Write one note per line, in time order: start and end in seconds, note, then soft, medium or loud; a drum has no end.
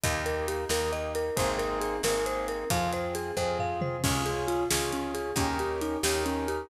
0.04 0.66 D#2 loud
0.04 0.64 A#3 loud
0.04 0.64 D#4 loud
0.04 0.64 G4 loud
0.04 0.24 D#5 medium
0.04 kick loud
0.04 closed hi-hat loud
0.26 0.46 A#4 medium
0.26 closed hi-hat medium
0.48 0.69 G4 medium
0.48 closed hi-hat loud
0.69 1.31 D#2 medium
0.69 1.30 A#3 medium
0.69 1.30 D#4 medium
0.69 1.30 G4 medium
0.69 0.91 A#4 medium
0.69 snare loud
0.92 1.13 D#5 medium
0.92 closed hi-hat medium
1.15 1.36 A#4 medium
1.15 closed hi-hat medium
1.36 2.00 G#1 medium
1.36 1.96 A#3 loud
1.36 1.96 C4 loud
1.36 1.96 D#4 loud
1.36 1.96 G#4 loud
1.36 1.58 C5 medium
1.36 kick loud
1.36 closed hi-hat loud
1.58 1.79 A#4 medium
1.58 closed hi-hat medium
1.81 2.01 G#4 medium
1.81 closed hi-hat medium
2.03 2.65 G#1 medium
2.03 2.64 A#3 loud
2.03 2.64 C4 loud
2.03 2.64 D#4 loud
2.03 2.64 G#4 loud
2.03 2.25 A#4 medium
2.03 snare loud
2.26 2.47 C5 medium
2.26 closed hi-hat medium
2.48 2.69 A#4 medium
2.48 closed hi-hat medium
2.70 3.32 F2 medium
2.70 3.31 C4 loud
2.70 3.31 F4 loud
2.70 3.31 G#4 medium
2.70 2.91 F5 medium
2.70 kick loud
2.70 closed hi-hat loud
2.93 3.14 C5 medium
2.93 closed hi-hat medium
3.15 3.36 G#4 medium
3.15 closed hi-hat loud
3.37 3.98 F2 medium
3.37 3.97 C4 loud
3.37 3.97 F4 medium
3.37 3.97 G#4 loud
3.37 3.57 C5 medium
3.37 kick medium
3.59 3.80 F5 medium
3.59 floor tom loud
3.81 4.02 C5 medium
3.81 mid tom loud
4.03 4.66 C#2 medium
4.03 4.24 C#4 medium
4.03 4.64 C#4 loud
4.03 4.64 F4 loud
4.03 4.64 G#4 loud
4.03 kick loud
4.03 crash loud
4.26 4.46 G#4 medium
4.26 closed hi-hat medium
4.48 4.68 F4 medium
4.48 closed hi-hat medium
4.71 5.33 C#2 medium
4.71 5.31 C#4 loud
4.71 5.31 F4 medium
4.71 4.91 G#4 medium
4.71 5.31 G#4 medium
4.71 snare loud
4.92 5.13 C#4 medium
4.92 closed hi-hat medium
5.14 5.35 G#4 medium
5.14 closed hi-hat medium
5.36 5.97 D#2 medium
5.36 5.58 C#4 medium
5.36 5.97 C#4 loud
5.36 5.97 D#4 loud
5.36 5.97 G4 loud
5.36 5.97 A#4 loud
5.36 kick loud
5.36 closed hi-hat loud
5.59 5.80 G4 medium
5.59 closed hi-hat medium
5.81 6.02 D#4 medium
5.81 closed hi-hat medium
6.03 6.65 D#2 medium
6.03 6.66 C#4 loud
6.03 6.66 D#4 loud
6.03 6.24 G4 medium
6.03 6.66 G4 medium
6.03 6.66 A#4 loud
6.03 snare loud
6.26 6.46 C#4 medium
6.26 closed hi-hat medium
6.48 6.69 G4 medium
6.48 closed hi-hat medium